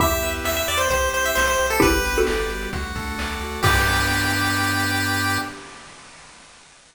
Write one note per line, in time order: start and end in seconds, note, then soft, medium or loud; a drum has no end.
0.00 0.19 E2 medium
0.00 0.44 B3 medium
0.00 0.80 E4 medium
0.00 0.45 E4 medium
0.00 0.68 G4 medium
0.00 0.80 G4 medium
0.00 0.44 G4 medium
0.00 0.30 E5 medium
0.00 kick medium
0.00 closed hi-hat medium
0.11 closed hi-hat medium
0.22 0.41 E2 medium
0.22 0.87 B4 medium
0.22 closed hi-hat medium
0.34 closed hi-hat medium
0.44 0.64 E2 medium
0.44 0.90 B3 medium
0.44 0.90 G4 medium
0.44 0.90 B4 medium
0.44 0.56 E5 medium
0.44 0.89 E5 medium
0.44 snare medium
0.56 0.67 E5 medium
0.56 closed hi-hat medium
0.68 0.88 E2 medium
0.68 0.90 G4 medium
0.68 0.79 D5 medium
0.68 closed hi-hat medium
0.77 0.88 C5 medium
0.77 closed hi-hat medium
0.90 1.09 C2 medium
0.90 1.36 C4 loud
0.90 1.36 E4 medium
0.90 1.59 G4 medium
0.90 1.36 G4 medium
0.90 1.09 C5 medium
0.90 kick medium
0.90 closed hi-hat medium
1.01 closed hi-hat medium
1.13 1.32 C2 medium
1.13 1.78 C5 medium
1.13 1.25 C5 medium
1.13 closed hi-hat medium
1.24 1.36 E5 medium
1.24 closed hi-hat medium
1.35 1.56 C2 medium
1.35 1.82 C4 medium
1.35 1.82 G4 medium
1.35 1.46 C5 medium
1.35 1.82 C5 medium
1.35 1.80 E5 medium
1.35 snare medium
1.47 1.67 C5 medium
1.47 closed hi-hat soft
1.58 1.79 C2 medium
1.58 1.81 G4 medium
1.58 closed hi-hat medium
1.70 1.81 A4 medium
1.70 closed hi-hat medium
1.80 2.02 G1 medium
1.80 2.27 B3 loud
1.80 2.27 D4 medium
1.80 1.91 E4 medium
1.80 1.91 G4 medium
1.80 2.49 G4 loud
1.80 2.27 G4 medium
1.80 2.20 B4 medium
1.80 kick loud
1.80 closed hi-hat medium
1.93 closed hi-hat medium
2.05 2.24 G1 medium
2.05 2.69 B4 medium
2.05 closed hi-hat medium
2.15 2.50 F#4 medium
2.15 2.50 A4 medium
2.15 closed hi-hat medium
2.27 2.48 G1 medium
2.27 2.73 G3 medium
2.27 2.73 B3 medium
2.27 2.73 G4 medium
2.27 2.71 D5 medium
2.27 snare medium
2.39 closed hi-hat medium
2.49 2.68 G1 medium
2.49 2.72 G4 medium
2.49 closed hi-hat medium
2.62 closed hi-hat medium
2.73 2.93 D2 medium
2.73 3.18 A3 medium
2.73 3.19 D4 medium
2.73 3.40 F#4 medium
2.73 3.18 F#4 medium
2.73 kick medium
2.73 closed hi-hat medium
2.83 closed hi-hat medium
2.95 3.15 D2 medium
2.95 3.60 A4 medium
2.95 kick medium
2.95 closed hi-hat medium
3.07 closed hi-hat medium
3.18 3.37 D2 medium
3.18 3.63 A3 medium
3.18 3.63 F#4 medium
3.18 3.63 A4 loud
3.18 3.61 D5 medium
3.18 snare medium
3.30 closed hi-hat medium
3.40 3.59 D2 medium
3.40 3.62 F#4 medium
3.40 closed hi-hat medium
3.52 closed hi-hat medium
3.62 5.38 G2 loud
3.62 5.37 B3 loud
3.62 5.37 D4 loud
3.62 5.37 G4 loud
3.62 5.38 G4 loud
3.62 5.39 G4 loud
3.62 5.39 B4 loud
3.62 5.39 D5 loud
3.62 kick loud
3.62 crash loud